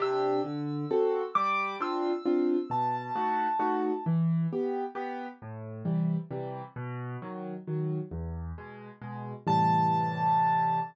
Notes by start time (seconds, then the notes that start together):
0.00 C3 D4 G4 E6
0.44 D3
0.91 C4 F#4 A4
1.35 G3 D6
1.80 C4 D4 F4 E6
2.25 C4 D4 F4
2.70 B2 A5
3.16 A3 D#4 F#4
3.59 A3 D#4 F#4
4.06 E3
4.53 B3 G4
4.95 B3 G4
5.42 A2
5.85 C3 E3 G3
6.31 C3 E3 G3
6.76 B2
7.22 D#3 F#3
7.67 D#3 F#3
8.11 E2
8.58 B2 G#3
9.02 B2 G#3
9.47 A2 C3 E3 G3 A5